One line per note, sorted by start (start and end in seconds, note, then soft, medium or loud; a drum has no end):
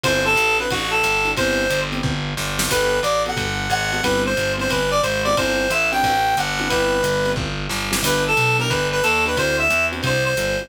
0.04 0.35 G1 medium
0.04 0.31 C4 loud
0.04 0.31 D4 loud
0.04 0.31 E4 loud
0.04 0.31 F#4 loud
0.04 0.23 C5 loud
0.04 kick medium
0.04 ride loud
0.25 0.57 A4 loud
0.36 0.67 A1 medium
0.36 hi-hat pedal loud
0.36 ride loud
0.59 0.80 C4 medium
0.59 0.80 D4 medium
0.59 0.80 E4 medium
0.59 0.80 F#4 medium
0.59 0.70 B4 medium
0.59 ride medium
0.70 1.02 A1 medium
0.70 0.90 F#4 medium
0.70 kick medium
0.70 ride loud
0.91 1.30 A4 medium
1.03 1.35 G1 medium
1.03 hi-hat pedal loud
1.03 ride loud
1.25 1.33 C4 loud
1.25 1.33 D4 loud
1.25 1.33 E4 loud
1.25 1.33 F#4 medium
1.25 ride medium
1.37 1.68 G1 loud
1.37 1.64 B3 loud
1.37 1.64 C4 loud
1.37 1.64 E4 loud
1.37 1.64 G4 loud
1.37 1.80 C5 loud
1.37 kick medium
1.37 ride loud
1.70 2.01 G1 medium
1.70 hi-hat pedal loud
1.70 ride loud
1.92 2.12 B3 medium
1.92 2.12 C4 medium
1.92 2.12 E4 medium
1.92 2.12 G4 medium
1.92 ride medium
2.03 2.34 G1 medium
2.03 kick loud
2.37 2.68 G1 medium
2.37 snare medium
2.59 2.67 B3 medium
2.59 2.67 C4 medium
2.59 2.67 E4 medium
2.59 2.67 G4 loud
2.59 snare loud
2.69 3.00 G1 medium
2.69 2.98 B3 loud
2.69 2.98 F#4 loud
2.69 2.98 G4 loud
2.69 2.98 A4 loud
2.69 3.00 B4 loud
2.69 kick medium
2.69 crash loud
2.69 ride loud
3.03 3.34 A1 medium
3.03 3.22 D5 medium
3.03 hi-hat pedal medium
3.03 ride loud
3.26 3.47 B3 loud
3.26 3.47 F#4 medium
3.26 3.47 G4 medium
3.26 3.47 A4 medium
3.26 3.71 F#5 medium
3.26 ride medium
3.37 3.68 G1 medium
3.37 kick medium
3.37 ride loud
3.70 4.01 G#1 medium
3.70 4.02 F#5 loud
3.70 hi-hat pedal medium
3.70 ride medium
3.92 4.00 B3 medium
3.92 4.00 F#4 medium
3.92 4.00 G4 medium
3.92 4.00 A4 medium
3.92 ride medium
4.03 4.34 G1 medium
4.03 4.31 B3 loud
4.03 4.31 C4 medium
4.03 4.31 E4 medium
4.03 4.31 G4 medium
4.03 4.22 B4 loud
4.03 kick medium
4.03 ride loud
4.26 4.52 C5 medium
4.37 4.68 G1 loud
4.37 hi-hat pedal medium
4.37 ride loud
4.58 4.79 B3 medium
4.58 4.79 C4 loud
4.58 4.79 E4 loud
4.58 4.79 G4 medium
4.58 4.70 C5 medium
4.58 ride medium
4.69 5.00 G1 medium
4.69 4.90 B4 medium
4.69 kick medium
4.69 ride loud
4.91 5.01 D5 loud
5.03 5.34 G#1 medium
5.03 5.22 C5 medium
5.03 hi-hat pedal medium
5.03 ride loud
5.24 5.34 B3 medium
5.24 5.34 C4 loud
5.24 5.34 E4 medium
5.24 5.34 G4 loud
5.24 5.35 D5 medium
5.24 ride medium
5.37 5.68 G1 medium
5.37 5.65 C4 loud
5.37 5.65 D4 loud
5.37 5.65 E4 loud
5.37 5.65 F#4 loud
5.37 5.70 C5 loud
5.37 kick medium
5.37 ride loud
5.70 6.01 A1 medium
5.70 5.89 E5 medium
5.70 hi-hat pedal loud
5.70 ride loud
5.92 6.13 C4 medium
5.92 6.13 D4 medium
5.92 6.13 E4 medium
5.92 6.13 F#4 medium
5.92 6.36 G5 loud
5.92 ride medium
6.03 6.34 A1 medium
6.03 kick medium
6.03 ride loud
6.37 6.68 G1 medium
6.37 6.69 F#5 medium
6.37 hi-hat pedal loud
6.37 ride loud
6.59 6.67 C4 loud
6.59 6.67 D4 loud
6.59 6.67 E4 loud
6.59 6.67 F#4 medium
6.59 ride medium
6.69 7.02 G1 loud
6.69 6.98 B3 loud
6.69 6.98 C4 loud
6.69 6.98 E4 loud
6.69 6.98 G4 loud
6.69 7.31 B4 medium
6.69 kick medium
6.69 ride loud
7.03 7.34 G1 medium
7.03 hi-hat pedal loud
7.03 ride loud
7.25 7.46 B3 medium
7.25 7.46 C4 medium
7.25 7.46 E4 medium
7.25 7.46 G4 medium
7.25 ride medium
7.36 7.67 G1 medium
7.36 kick loud
7.69 8.00 G1 medium
7.69 snare medium
7.91 7.99 B3 medium
7.91 7.99 C4 medium
7.91 7.99 E4 medium
7.91 7.99 G4 loud
7.91 snare loud
8.02 8.33 G1 medium
8.02 8.31 B3 medium
8.02 8.31 D4 loud
8.02 8.31 E4 loud
8.02 8.31 G4 loud
8.02 8.23 B4 loud
8.02 kick medium
8.02 crash loud
8.02 ride loud
8.28 8.57 A4 medium
8.37 8.68 B1 medium
8.37 hi-hat pedal medium
8.37 ride loud
8.59 8.79 B3 medium
8.59 8.79 D4 loud
8.59 8.79 E4 medium
8.59 8.79 G4 medium
8.59 8.70 A#4 loud
8.59 ride medium
8.70 9.01 G1 medium
8.70 8.87 B4 medium
8.70 kick medium
8.70 ride loud
8.92 9.03 B4 loud
9.03 9.36 D#2 medium
9.03 9.24 A4 medium
9.03 hi-hat pedal loud
9.03 ride loud
9.26 9.34 B3 medium
9.26 9.34 D4 medium
9.26 9.34 E4 loud
9.26 9.34 G4 medium
9.26 9.38 B4 medium
9.26 ride medium
9.37 9.68 D2 medium
9.37 9.65 C4 loud
9.37 9.65 D4 loud
9.37 9.65 E4 loud
9.37 9.65 F#4 loud
9.37 9.57 C5 loud
9.37 kick medium
9.37 ride loud
9.59 9.85 E5 loud
9.70 10.01 E2 medium
9.70 hi-hat pedal loud
9.70 ride loud
9.92 10.12 C4 medium
9.92 10.12 D4 loud
9.92 10.12 E4 medium
9.92 10.12 F#4 medium
9.92 ride medium
10.03 10.34 C2 medium
10.03 10.24 C5 loud
10.03 kick medium
10.03 ride loud
10.26 10.69 C5 medium
10.37 10.68 G1 medium
10.37 hi-hat pedal loud
10.37 ride medium
10.59 10.68 C4 medium
10.59 10.68 D4 medium
10.59 10.68 E4 loud
10.59 10.68 F#4 medium
10.59 ride medium